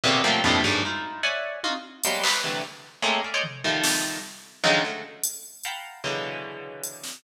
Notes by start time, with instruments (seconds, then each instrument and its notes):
0.04 orchestral harp A#2 B2 C3 C#3 D3
0.24 orchestral harp F3 F#3 G3 A3 A#3 C4
0.44 orchestral harp F2 G2 A2 A#2 B2 C3
0.64 orchestral harp F#2 G2 G#2
0.85 orchestral harp D#4 E4 F4
1.23 orchestral harp C#5 D5 E5 F#5 G#5
1.64 orchestral harp D#4 F4 F#4, high tom
2.04 orchestral harp F#3 G3 G#3 A#3 B3, closed hi-hat
2.24 orchestral harp B4 C5 C#5, clap
2.44 orchestral harp C3 D3 E3 F#3 G3 A3
3.02 orchestral harp G#3 A3 A#3 C4 C#4
3.24 orchestral harp D5 E5 F5
3.34 orchestral harp C5 C#5 D5 D#5
3.44 floor tom
3.64 orchestral harp D#3 F3 G3 A3
3.84 snare
4.64 orchestral harp C#3 D3 D#3 F3 F#3 G#3
4.84 orchestral harp F#3 G#3 A3
5.24 closed hi-hat
5.64 orchestral harp F5 F#5 G5 A5 A#5 B5, closed hi-hat
6.04 orchestral harp B2 C#3 D3 E3 F#3 G#3
6.84 closed hi-hat
7.04 snare